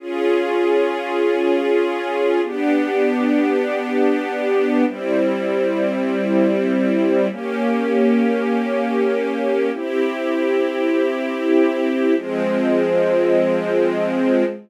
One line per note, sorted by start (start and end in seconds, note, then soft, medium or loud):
0.00 2.41 C#4 medium
0.00 2.41 F4 loud
0.00 2.41 G#4 loud
2.43 4.84 B3 loud
2.43 4.84 D4 loud
2.43 4.84 G4 loud
4.86 7.27 G3 loud
4.86 7.27 C4 loud
4.86 7.27 E4 medium
7.30 9.71 A#3 loud
7.30 9.71 C#4 medium
7.30 9.71 G4 medium
9.73 12.14 C4 medium
9.73 12.14 E4 loud
9.73 12.14 G4 loud
12.16 14.44 F3 loud
12.16 14.44 G#3 loud
12.16 14.44 C4 loud